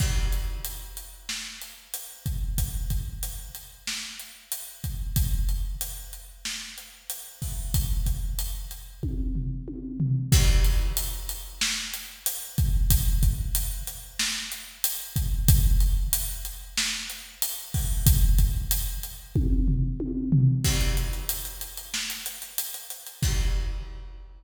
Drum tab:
CC |x---------------|----------------|----------------|----------------|
HH |--x-x-x---x-x-x-|x-x-x-x---x-x-x-|x-x-x-x---x-x-o-|x-x-x-x---------|
SD |--------o-------|--------o-------|--------o-------|----------------|
T1 |----------------|----------------|----------------|--------o---o---|
FT |----------------|----------------|----------------|----------o---o-|
BD |o-------------o-|o-o-----------o-|o-------------o-|o-o-----o-------|

CC |x---------------|----------------|----------------|----------------|
HH |--x-x-x---x-x-x-|x-x-x-x---x-x-x-|x-x-x-x---x-x-o-|x-x-x-x---------|
SD |--------o-------|--------o-------|--------o-------|----------------|
T1 |----------------|----------------|----------------|--------o---o---|
FT |----------------|----------------|----------------|----------o---o-|
BD |o-------------o-|o-o-----------o-|o-------------o-|o-o-----o-------|

CC |x---------------|x---------------|
HH |-xxxxxxx-xxxxxxx|----------------|
SD |--------o-------|----------------|
T1 |----------------|----------------|
FT |----------------|----------------|
BD |o---------------|o---------------|